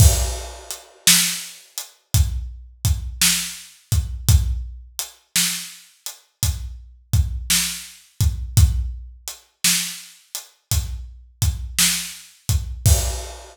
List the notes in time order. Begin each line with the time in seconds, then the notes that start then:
0.00 kick, crash
0.71 closed hi-hat
1.07 snare
1.78 closed hi-hat
2.14 kick, closed hi-hat
2.85 kick, closed hi-hat
3.21 snare
3.92 kick, closed hi-hat
4.29 kick, closed hi-hat
4.99 closed hi-hat
5.36 snare
6.06 closed hi-hat
6.43 kick, closed hi-hat
7.13 kick, closed hi-hat
7.50 snare
8.21 kick, closed hi-hat
8.57 kick, closed hi-hat
9.28 closed hi-hat
9.64 snare
10.35 closed hi-hat
10.71 kick, closed hi-hat
11.42 kick, closed hi-hat
11.79 snare
12.49 kick, closed hi-hat
12.86 kick, crash